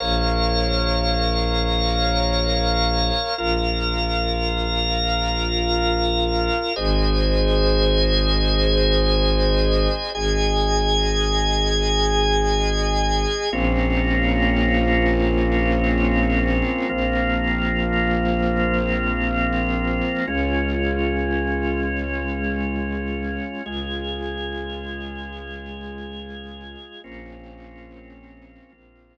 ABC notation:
X:1
M:4/4
L:1/8
Q:1/4=71
K:Bbm
V:1 name="Drawbar Organ"
[Bdf]8 | [FBf]8 | [Ace]8 | [Aea]8 |
[B,CDF]8 | [F,B,CF]8 | [A,DF]8 | [A,FA]8 |
[B,CDF]4 [F,B,CF]4 |]
V:2 name="Violin" clef=bass
B,,,8 | B,,,8 | A,,,8 | A,,,8 |
B,,,8 | B,,,8 | D,,8 | D,,8 |
B,,,4 B,,,4 |]